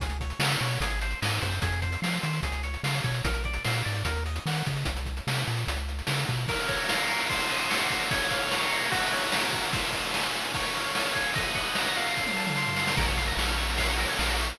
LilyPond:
<<
  \new Staff \with { instrumentName = "Lead 1 (square)" } { \time 4/4 \key des \major \tempo 4 = 148 aes'8 des''8 f''8 des''8 aes'8 c''8 ees''8 c''8 | aes'8 c''8 f''8 c''8 aes'8 des''8 f''8 des''8 | bes'8 d''8 f''8 d''8 bes'8 ees''8 ges''8 ees''8 | r1 |
\key bes \minor bes'8 des''8 f''8 bes'8 c''8 ees''8 ges''8 c''8 | des''8 f''8 bes''8 des''8 ges'8 des''8 bes''8 ges'8 | c''8 ees''8 aes''8 c''8 des''8 f''8 aes''8 des''8 | ees''8 ges''8 bes''8 f''4 a''8 c'''8 f''8 |
bes'16 des''16 f''16 bes''16 des'''16 f'''16 des'''16 bes''16 f''16 des''16 bes'16 des''16 f''16 bes''16 des'''16 f'''16 | }
  \new Staff \with { instrumentName = "Synth Bass 1" } { \clef bass \time 4/4 \key des \major des,4 des8 b,8 aes,,4 aes,8 ges,8 | f,4 f8 ees8 des,4 des8 b,8 | bes,,4 bes,8 aes,8 ees,4 ees8 des8 | c,4 c8 bes,8 des,4 des8 b,8 |
\key bes \minor r1 | r1 | r1 | r1 |
bes,,4 bes,,2 bes,,4 | }
  \new DrumStaff \with { instrumentName = "Drums" } \drummode { \time 4/4 <hh bd>16 hh16 <hh bd>16 hh16 sn16 hh16 hh16 hh16 <hh bd>16 hh16 hh16 hh16 sn16 hh16 <hh bd>16 hh16 | <hh bd>16 hh16 <hh bd>16 hh16 sn16 hh16 hh16 hh16 <hh bd>16 hh16 hh16 hh16 sn16 hh16 <hh bd>16 hh16 | <hh bd>16 hh16 <hh bd>16 hh16 sn16 hh16 hh16 hh16 <hh bd>16 hh16 hh16 hh16 sn16 hh16 <hh bd>16 hh16 | <hh bd>16 hh16 <hh bd>16 hh16 sn16 hh16 hh16 hh16 <hh bd>16 hh16 hh16 hh16 sn16 hh16 <hh bd>16 hh16 |
<cymc bd>16 cymr16 <bd cymr>16 cymr16 sn16 cymr16 cymr16 cymr16 <bd cymr>16 cymr16 cymr16 cymr16 sn16 cymr16 <bd cymr>16 cymr16 | <bd cymr>16 cymr16 <bd cymr>16 cymr16 sn16 cymr16 cymr16 cymr16 <bd cymr>16 cymr16 cymr16 cymr16 sn16 cymr16 <bd cymr>16 cymr16 | <bd cymr>16 cymr16 <bd cymr>16 cymr16 sn16 cymr16 cymr16 cymr16 <bd cymr>16 cymr16 cymr16 cymr16 sn16 cymr16 <bd cymr>16 cymr16 | <bd cymr>16 cymr16 <bd cymr>16 cymr16 sn16 cymr16 cymr16 cymr16 <bd sn>16 tommh16 sn16 toml16 sn16 tomfh16 sn16 sn16 |
<cymc bd>16 cymr16 <bd cymr>16 cymr16 sn16 cymr16 cymr16 cymr16 <bd cymr>16 cymr16 cymr16 cymr16 sn16 cymr16 cymr16 cymr16 | }
>>